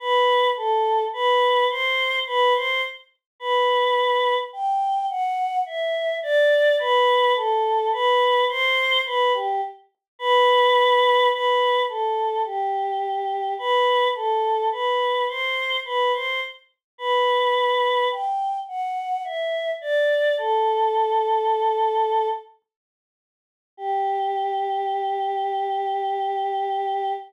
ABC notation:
X:1
M:3/4
L:1/16
Q:1/4=53
K:G
V:1 name="Choir Aahs"
B2 A2 B2 c2 B c z2 | B4 g2 f2 e2 d2 | B2 A2 B2 c2 B G z2 | B4 B2 A2 G4 |
B2 A2 B2 c2 B c z2 | B4 g2 f2 e2 d2 | A8 z4 | G12 |]